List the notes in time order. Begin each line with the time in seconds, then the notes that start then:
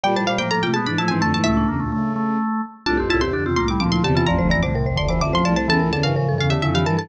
0.04 A#2 G3 D5 G5
0.15 A2 F3 C5 A5
0.27 A#2 G3 C5 F5
0.38 A2 F3 A#3 C5 G5
0.51 A2 F3 A#3 A4 A#5
0.63 C3 A3 F4 G5
0.74 B2 G#3 B3 G#4 A5
0.86 G#2 E3 D4 B5
0.98 A2 F3 E4 A5
1.08 G#2 E3 C4 G#5
1.21 F2 D3 A3 A5
1.33 G#2 E3 A3 A5
1.44 C#2 A2 A3 E4 E5
1.57 D4
1.68 E2 C#3 A#3
1.80 D2 A#2 A3
1.92 C#3 A3
2.16 A3
2.86 C2 A2 D4 F4 A5
2.97 A1 F2 C4 G4
3.09 C2 A2 E4 F4 A5
3.21 E2 C3 C4 G4 C6
3.33 F2 D3 D4 G4
3.45 E2 C3 C4 F4
3.56 C2 A2 A#3 F4 C6
3.68 G3 E4 D6
3.80 D2 A#2 F3 C4 D6
3.92 F3 E4 C6
4.04 E2 C3 D3 G4 A5
4.15 E3 F4 A5
4.26 A1 F2 F3 D5 A#5
4.38 F1 D2 C5
4.49 A1 F2 E3 D5 A#5
4.63 C2 A2 D3 C5 D6
4.75 C2 A2 C3 A#4
4.86 A1 F2 C5
4.96 F1 D2 D3 D5 C6
5.09 E3 C5 D6
5.20 A1 F2 D3 E5 D6
5.33 F3 C5 C6
5.43 C2 A2 F3 D5 A5
5.56 C5 A5
5.68 E2 C#3 E3 A4 A5
5.79 C#2 A2 A#4
5.92 E2 C#3 D3 A4 A5
6.03 G2 C#3 E3 A#4 F5
6.15 A2 C#3 F3 A#4
6.27 G2 E3 A4
6.38 E2 C#3 A4 F5
6.50 D3 G4 E5
6.62 F2 C#3 D3 E4 E5
6.74 E3 G4 F5
6.85 G2 E3 A#4 A5
6.97 A4 A5